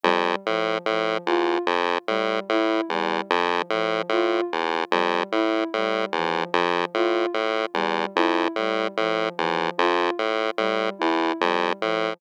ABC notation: X:1
M:9/8
L:1/8
Q:3/8=49
K:none
V:1 name="Lead 1 (square)" clef=bass
F,, A,, A,, | E,, F,, A,, A,, E,, F,, A,, A,, E,, | F,, A,, A,, E,, F,, A,, A,, E,, F,, | A,, A,, E,, F,, A,, A,, E,, F,, A,, |]
V:2 name="Ocarina"
G, F, F, | F z G, E G, F, F, F z | G, E G, F, F, F z G, E | G, F, F, F z G, E G, F, |]